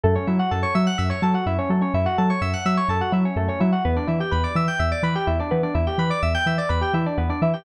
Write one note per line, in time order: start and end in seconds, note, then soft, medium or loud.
0.03 0.17 F#2 loud
0.03 0.15 A3 medium
0.03 0.14 A4 loud
0.15 0.27 C#4 medium
0.15 0.26 C#5 medium
0.27 0.40 F#3 medium
0.27 0.38 E4 medium
0.27 0.38 E5 medium
0.39 0.50 F#4 medium
0.39 0.50 F#5 medium
0.51 0.65 F#2 medium
0.51 0.62 A4 medium
0.51 0.62 A5 medium
0.63 0.73 C#5 medium
0.63 0.74 C#6 medium
0.75 0.88 F#3 medium
0.75 0.85 E5 medium
0.75 0.86 E6 medium
0.87 0.98 F#5 medium
0.87 0.97 F#6 medium
0.98 1.12 F#2 medium
0.98 1.09 E5 medium
0.98 1.09 E6 medium
1.10 1.20 C#5 medium
1.10 1.21 C#6 medium
1.22 1.35 F#3 medium
1.22 1.34 A4 medium
1.22 1.33 A5 medium
1.34 1.45 F#4 medium
1.34 1.45 F#5 medium
1.46 1.59 F#2 medium
1.46 1.57 E4 medium
1.46 1.57 E5 medium
1.59 1.69 C#4 medium
1.59 1.69 C#5 medium
1.69 1.83 F#3 medium
1.69 1.81 A3 medium
1.69 1.81 A4 medium
1.81 1.92 C#4 medium
1.81 1.93 C#5 medium
1.94 2.07 F#2 medium
1.94 2.05 E4 medium
1.94 2.05 E5 medium
2.06 2.16 F#4 medium
2.06 2.17 F#5 medium
2.18 2.32 F#3 medium
2.18 2.29 A4 medium
2.18 2.29 A5 medium
2.30 2.41 C#5 medium
2.30 2.40 C#6 medium
2.41 2.54 F#2 medium
2.41 2.52 E5 medium
2.41 2.52 E6 medium
2.53 2.64 F#5 medium
2.53 2.64 F#6 medium
2.65 2.79 F#3 medium
2.65 2.77 E5 medium
2.65 2.76 E6 medium
2.77 2.88 C#5 medium
2.77 2.88 C#6 medium
2.88 3.01 F#2 medium
2.88 3.01 A4 medium
2.88 3.00 A5 medium
3.01 3.12 F#4 medium
3.01 3.12 F#5 medium
3.12 3.25 F#3 medium
3.12 3.23 E4 medium
3.12 3.24 E5 medium
3.25 3.36 C#4 medium
3.25 3.36 C#5 medium
3.36 3.49 F#2 medium
3.36 3.47 A3 medium
3.36 3.48 A4 medium
3.48 3.59 C#4 medium
3.48 3.60 C#5 medium
3.60 3.74 F#3 medium
3.60 3.71 E4 medium
3.60 3.71 E5 medium
3.72 3.83 F#4 medium
3.72 3.83 F#5 medium
3.85 3.98 E2 medium
3.85 3.95 B3 medium
3.85 3.95 B4 medium
3.96 4.07 D4 medium
3.96 4.07 D5 medium
4.07 4.21 E3 medium
4.07 4.18 E4 medium
4.07 4.19 E5 medium
4.20 4.31 G4 medium
4.20 4.31 G5 medium
4.31 4.45 E2 medium
4.31 4.42 B4 medium
4.31 4.43 B5 medium
4.44 4.54 D5 medium
4.44 4.54 D6 medium
4.55 4.68 E3 medium
4.55 4.67 E5 medium
4.55 4.67 E6 medium
4.68 4.79 G5 medium
4.68 4.78 G6 medium
4.79 4.93 E2 medium
4.79 4.90 E5 medium
4.79 4.90 E6 medium
4.92 5.02 D5 medium
4.92 5.02 D6 medium
5.03 5.16 E3 medium
5.03 5.14 B4 medium
5.03 5.14 B5 medium
5.15 5.26 G4 medium
5.15 5.26 G5 medium
5.27 5.40 E2 medium
5.27 5.38 E4 medium
5.27 5.38 E5 medium
5.39 5.51 D4 medium
5.39 5.50 D5 medium
5.51 5.65 E3 medium
5.51 5.62 B3 medium
5.51 5.62 B4 medium
5.63 5.74 D4 medium
5.63 5.74 D5 medium
5.75 5.88 E2 medium
5.75 5.85 E4 medium
5.75 5.86 E5 medium
5.87 5.98 G4 medium
5.87 5.97 G5 medium
5.98 6.11 E3 medium
5.98 6.10 B4 medium
5.98 6.09 B5 medium
6.10 6.21 D5 medium
6.10 6.21 D6 medium
6.22 6.36 E2 medium
6.22 6.34 E5 medium
6.22 6.33 E6 medium
6.34 6.46 G5 medium
6.34 6.45 G6 medium
6.46 6.59 E3 medium
6.46 6.58 E5 medium
6.46 6.57 E6 medium
6.58 6.69 D5 medium
6.58 6.69 D6 medium
6.69 6.83 E2 medium
6.69 6.80 B4 medium
6.69 6.81 B5 medium
6.81 6.92 G4 medium
6.81 6.93 G5 medium
6.94 7.07 E3 medium
6.94 7.05 E4 medium
6.94 7.05 E5 medium
7.06 7.17 D4 medium
7.06 7.17 D5 medium
7.18 7.31 E2 medium
7.18 7.28 B3 medium
7.18 7.28 B4 medium
7.29 7.40 D4 medium
7.29 7.40 D5 medium
7.42 7.55 E3 medium
7.42 7.53 E4 medium
7.42 7.53 E5 medium
7.53 7.64 G4 medium
7.53 7.64 G5 medium